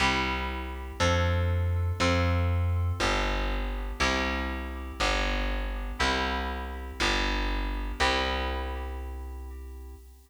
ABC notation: X:1
M:2/2
L:1/8
Q:1/2=60
K:C
V:1 name="Electric Piano 2"
[CEG]4 [DFA]4 | [CFA]4 [B,DG]4 | [CEG]4 [B,DG]4 | [CEG]4 [B,DG]4 |
[CEG]8 |]
V:2 name="Electric Bass (finger)" clef=bass
C,,4 F,,4 | F,,4 G,,,4 | C,,4 G,,,4 | C,,4 G,,,4 |
C,,8 |]